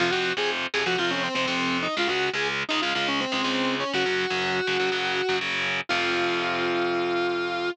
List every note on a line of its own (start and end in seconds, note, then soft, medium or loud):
0.00 0.10 F2 loud
0.00 0.10 C3 medium
0.00 0.10 F3 medium
0.00 0.11 F4 loud
0.11 0.32 F2 medium
0.11 0.32 C3 medium
0.11 0.32 F3 medium
0.11 0.32 F#4 medium
0.37 0.66 F2 medium
0.37 0.66 C3 medium
0.37 0.66 F3 medium
0.37 0.49 G#4 medium
0.74 0.84 F2 medium
0.74 0.84 C3 medium
0.74 0.84 F3 medium
0.74 0.86 G#4 medium
0.86 0.96 F2 medium
0.86 0.96 C3 medium
0.86 0.96 F3 medium
0.86 0.98 F#4 medium
0.98 1.28 F2 medium
0.98 1.28 C3 medium
0.98 1.28 F3 medium
0.98 1.11 F4 medium
1.10 1.22 C#4 medium
1.23 1.34 C4 medium
1.35 1.45 F2 medium
1.35 1.45 C3 medium
1.35 1.45 F3 medium
1.35 1.45 C4 medium
1.45 1.87 F2 medium
1.45 1.87 C3 medium
1.45 1.87 F3 medium
1.45 1.77 C4 medium
1.83 1.94 D#4 medium
1.97 2.07 C#2 medium
1.97 2.07 C#3 medium
1.97 2.07 G#3 medium
1.97 2.10 F4 loud
2.07 2.29 C#2 medium
2.07 2.29 C#3 medium
2.07 2.29 G#3 medium
2.07 2.29 F#4 medium
2.34 2.63 C#2 medium
2.34 2.63 C#3 medium
2.34 2.63 G#3 medium
2.34 2.47 G#4 medium
2.69 2.80 C#2 medium
2.69 2.80 C#3 medium
2.69 2.80 G#3 medium
2.69 2.80 D#4 medium
2.82 2.93 C#2 medium
2.82 2.93 C#3 medium
2.82 2.93 G#3 medium
2.82 2.93 F4 medium
2.95 3.25 C#2 medium
2.95 3.25 C#3 medium
2.95 3.25 G#3 medium
2.95 3.07 F4 loud
3.08 3.20 C#4 medium
3.20 3.32 C4 medium
3.32 3.42 C#2 medium
3.32 3.42 C#3 medium
3.32 3.42 G#3 medium
3.32 3.42 C4 medium
3.43 3.84 C#2 medium
3.43 3.84 C#3 medium
3.43 3.84 G#3 medium
3.43 3.75 C4 medium
3.80 3.92 C#4 medium
3.94 4.03 F#2 loud
3.94 4.03 C#3 medium
3.94 4.03 F#3 medium
3.94 5.36 F#4 loud
4.06 4.25 F#2 medium
4.06 4.25 C#3 medium
4.06 4.25 F#3 medium
4.30 4.60 F#2 medium
4.30 4.60 C#3 medium
4.30 4.60 F#3 medium
4.67 4.77 F#2 medium
4.67 4.77 C#3 medium
4.67 4.77 F#3 medium
4.80 4.89 F#2 medium
4.80 4.89 C#3 medium
4.80 4.89 F#3 medium
4.92 5.21 F#2 medium
4.92 5.21 C#3 medium
4.92 5.21 F#3 medium
5.29 5.39 F#2 medium
5.29 5.39 C#3 medium
5.29 5.39 F#3 medium
5.41 5.80 F#2 medium
5.41 5.80 C#3 medium
5.41 5.80 F#3 medium
5.89 7.70 F2 loud
5.89 7.70 C3 loud
5.89 7.70 F3 loud
5.89 7.69 F4 loud